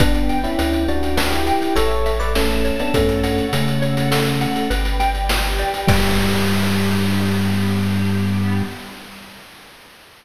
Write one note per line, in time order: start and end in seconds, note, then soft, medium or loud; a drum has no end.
0.00 0.47 G1 loud
0.00 0.38 B3 medium
0.00 0.38 D4 medium
0.00 0.87 B4 medium
0.00 0.58 B4 loud
0.00 0.87 D5 medium
0.00 0.87 G5 medium
0.00 kick loud
0.00 closed hi-hat loud
0.14 closed hi-hat medium
0.29 1.47 G5 medium
0.29 closed hi-hat medium
0.44 0.83 C#4 medium
0.44 0.83 E4 medium
0.44 closed hi-hat medium
0.58 1.53 D2 medium
0.58 1.17 B4 medium
0.58 closed hi-hat medium
0.73 closed hi-hat medium
0.88 1.16 D4 medium
0.88 1.16 F#4 medium
0.88 1.75 G4 medium
0.88 1.75 B4 medium
0.88 1.72 D5 medium
0.88 1.75 G5 medium
0.88 closed hi-hat medium
1.03 closed hi-hat medium
1.17 1.32 D4 medium
1.17 1.32 F#4 medium
1.17 1.73 B4 medium
1.17 snare loud
1.32 1.75 E4 medium
1.32 1.75 G4 medium
1.32 closed hi-hat medium
1.47 1.75 G5 medium
1.47 closed hi-hat medium
1.62 closed hi-hat medium
1.76 2.71 A1 loud
1.76 2.11 A4 medium
1.76 2.33 A4 medium
1.76 2.35 A4 loud
1.76 2.11 C#5 medium
1.76 2.34 C#5 medium
1.76 2.33 E5 medium
1.76 closed hi-hat loud
1.91 closed hi-hat medium
2.06 2.90 E5 medium
2.06 closed hi-hat medium
2.20 2.34 B4 medium
2.20 2.34 D5 medium
2.20 closed hi-hat medium
2.34 2.75 A3 medium
2.34 2.75 C#4 medium
2.34 2.92 A4 medium
2.34 2.91 A4 medium
2.34 2.92 E5 medium
2.34 2.92 A5 medium
2.34 snare medium
2.50 closed hi-hat medium
2.65 2.93 C#5 medium
2.65 closed hi-hat medium
2.79 2.94 B3 medium
2.79 2.94 D4 medium
2.79 closed hi-hat medium
2.94 3.42 F#2 loud
2.94 3.46 A3 medium
2.94 3.46 C#4 medium
2.94 3.52 A4 loud
2.94 3.82 A4 medium
2.94 3.82 C#5 medium
2.94 3.82 F#5 medium
2.94 kick medium
2.94 closed hi-hat medium
3.09 closed hi-hat medium
3.24 4.41 F#5 medium
3.24 closed hi-hat medium
3.38 closed hi-hat medium
3.53 4.47 C#3 medium
3.53 4.68 A3 medium
3.53 4.68 C#4 medium
3.53 4.11 A4 medium
3.53 closed hi-hat loud
3.68 closed hi-hat medium
3.82 4.70 F#4 medium
3.82 4.70 A4 medium
3.82 4.66 C#5 medium
3.82 4.70 F#5 medium
3.82 closed hi-hat medium
3.97 closed hi-hat medium
4.11 4.67 A4 medium
4.11 snare loud
4.26 closed hi-hat medium
4.41 4.69 F#5 medium
4.41 closed hi-hat medium
4.56 closed hi-hat medium
4.70 5.65 G1 loud
4.70 5.28 B4 medium
4.70 5.29 B4 loud
4.70 5.28 D5 medium
4.70 5.28 G5 medium
4.70 closed hi-hat medium
4.85 closed hi-hat medium
5.00 5.84 G5 loud
5.00 closed hi-hat medium
5.15 closed hi-hat medium
5.29 5.87 G4 medium
5.29 5.87 B4 medium
5.29 5.86 B4 medium
5.29 5.87 G5 medium
5.29 snare loud
5.44 closed hi-hat medium
5.59 5.87 D5 medium
5.59 closed hi-hat medium
5.74 closed hi-hat medium
5.87 8.63 G2 loud
5.87 8.62 G3 loud
5.87 8.62 B3 loud
5.87 8.62 D4 loud
5.87 8.62 G4 loud
5.87 8.64 B4 loud
5.87 8.64 D5 loud
5.87 8.64 G5 loud
5.87 kick loud
5.87 crash loud